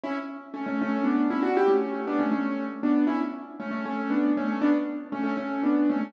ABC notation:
X:1
M:3/4
L:1/16
Q:1/4=118
K:D
V:1 name="Acoustic Grand Piano"
[CE] z3 [A,C] [A,C] [A,C]2 [B,D]2 [CE] [DF] | [EG] [A,C]3 [B,D] [A,C] [A,C]3 z [B,D]2 | [CE] z3 [A,C] [A,C] [A,C]2 [B,D]2 [A,C] [A,C] | [B,D] z3 [A,C] [A,C] [A,C]2 [B,D]2 [A,C] [A,C] |]